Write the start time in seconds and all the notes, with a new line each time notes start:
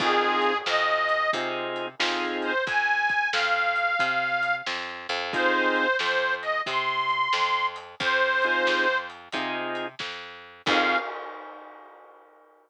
0.00 F2 C4 D#4 F4 G#4, kick, crash
0.42 closed hi-hat
0.66 F2 D#5, snare
1.09 closed hi-hat
1.33 C3 C4 D#4 F4 G#4, kick, closed hi-hat
1.76 closed hi-hat
1.99 F2 C4 D#4 F4 G#4, snare
2.42 C5, closed hi-hat
2.67 F2 G#5, kick, closed hi-hat
3.09 kick, closed hi-hat
3.33 F2 F5, snare
3.76 closed hi-hat
3.99 C3, kick, closed hi-hat
4.43 closed hi-hat
4.67 F2, snare
5.09 F2, closed hi-hat
5.33 C4 D#4 F4 G#4 C5, kick, closed hi-hat
5.76 closed hi-hat
5.99 F2 C5, snare
6.42 D#5, closed hi-hat
6.66 C3 C6, kick, closed hi-hat
7.09 closed hi-hat
7.33 F2, snare
7.76 closed hi-hat
8.00 F2 C5, kick, closed hi-hat
8.42 C4 D#4 F4 G#4, closed hi-hat
8.67 F2, snare
9.10 closed hi-hat
9.32 C3 C4 D#4 F4 G#4, kick, closed hi-hat
9.75 closed hi-hat
9.99 F2, kick, snare
10.66 F2 C4 D#4 F4 G#4 F5, kick, crash